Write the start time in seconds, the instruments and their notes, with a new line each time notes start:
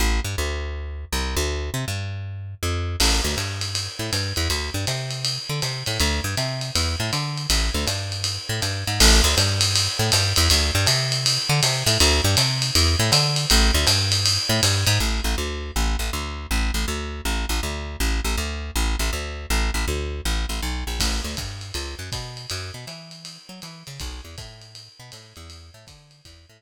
0.00 electric bass (finger) A1
0.24 electric bass (finger) G2
0.38 electric bass (finger) D2
1.12 electric bass (finger) C2
1.36 electric bass (finger) D2
1.74 electric bass (finger) C3
1.88 electric bass (finger) G2
2.63 electric bass (finger) F2
3.00 electric bass (finger) A1, crash, ride
3.24 electric bass (finger) D2
3.37 electric bass (finger) G2, hi-hat pedal, ride
3.61 ride
3.75 ride
3.99 electric bass (finger) A2
4.13 electric bass (finger) G2, hi-hat pedal, ride
4.36 electric bass (finger) E2, ride
4.50 electric bass (finger) D2, ride
4.74 electric bass (finger) G2
4.87 electric bass (finger) C3, hi-hat pedal, ride
5.11 ride
5.25 ride
5.49 electric bass (finger) D3
5.62 electric bass (finger) C3, hi-hat pedal, ride
5.86 electric bass (finger) A2, ride
6.00 electric bass (finger) D2, ride
6.24 electric bass (finger) G2
6.37 electric bass (finger) C3, hi-hat pedal, ride
6.61 ride
6.75 electric bass (finger) E2, ride
7.00 electric bass (finger) A2
7.13 electric bass (finger) D3, hi-hat pedal, ride
7.38 ride
7.50 electric bass (finger) A1, ride
7.74 electric bass (finger) D2
7.87 electric bass (finger) G2, hi-hat pedal, ride
8.12 ride
8.24 ride
8.49 electric bass (finger) A2
8.62 electric bass (finger) G2, hi-hat pedal, ride
8.87 electric bass (finger) G#2, ride
9.00 electric bass (finger) A1, crash, ride
9.24 electric bass (finger) D2
9.37 electric bass (finger) G2, hi-hat pedal, ride
9.61 ride
9.76 ride
9.99 electric bass (finger) A2
10.12 electric bass (finger) G2, hi-hat pedal, ride
10.36 electric bass (finger) E2, ride
10.50 electric bass (finger) D2, ride
10.75 electric bass (finger) G2
10.86 electric bass (finger) C3, hi-hat pedal, ride
11.12 ride
11.26 ride
11.49 electric bass (finger) D3
11.63 electric bass (finger) C3, hi-hat pedal, ride
11.86 electric bass (finger) A2, ride
12.00 electric bass (finger) D2, ride
12.24 electric bass (finger) G2
12.37 electric bass (finger) C3, hi-hat pedal, ride
12.62 ride
12.75 electric bass (finger) E2, ride
12.99 electric bass (finger) A2
13.12 electric bass (finger) D3, hi-hat pedal, ride
13.36 ride
13.50 electric bass (finger) A1, ride
13.74 electric bass (finger) D2
13.87 electric bass (finger) G2, hi-hat pedal, ride
14.12 ride
14.26 ride
14.49 electric bass (finger) A2
14.63 electric bass (finger) G2, hi-hat pedal, ride
14.87 electric bass (finger) G#2, ride
15.00 electric bass (finger) A1
15.24 electric bass (finger) A1
15.38 electric bass (finger) D2
15.76 electric bass (finger) A1
15.99 electric bass (finger) A1
16.13 electric bass (finger) D2
16.51 electric bass (finger) A1
16.74 electric bass (finger) A1
16.88 electric bass (finger) D2
17.25 electric bass (finger) A1
17.49 electric bass (finger) A1
17.63 electric bass (finger) D2
18.00 electric bass (finger) A1
18.24 electric bass (finger) A1
18.37 electric bass (finger) D2
18.76 electric bass (finger) A1
18.99 electric bass (finger) A1
19.13 electric bass (finger) D2
19.50 electric bass (finger) A1
19.74 electric bass (finger) A1
19.88 electric bass (finger) D2
20.25 electric bass (finger) A1
20.49 electric bass (finger) A1
20.62 electric bass (finger) B1
20.87 electric bass (finger) A#1
21.00 electric bass (finger) A1, kick, crash, ride
21.24 electric bass (finger) D2
21.37 electric bass (finger) G2, kick, hi-hat pedal, ride
21.61 ride
21.74 electric bass (finger) C#2, ride
21.99 electric bass (finger) F#2
22.12 electric bass (finger) B2, kick, hi-hat pedal, ride
22.37 ride
22.50 electric bass (finger) F#2, ride
22.74 electric bass (finger) B2
22.87 electric bass (finger) E3, hi-hat pedal, ride
23.11 ride
23.25 ride
23.49 electric bass (finger) F#3
23.62 electric bass (finger) E3, hi-hat pedal, ride
23.87 electric bass (finger) C#3, ride
24.00 electric bass (finger) B1, kick, ride
24.25 electric bass (finger) E2
24.38 electric bass (finger) A2, kick, hi-hat pedal, ride
24.61 ride
24.75 ride
25.00 electric bass (finger) B2
25.12 electric bass (finger) A2, hi-hat pedal, ride
25.36 electric bass (finger) E2, ride
25.50 ride
25.74 electric bass (finger) A2
25.87 electric bass (finger) D3, kick, hi-hat pedal, ride
26.11 ride
26.25 electric bass (finger) E2, kick, ride
26.49 electric bass (finger) A2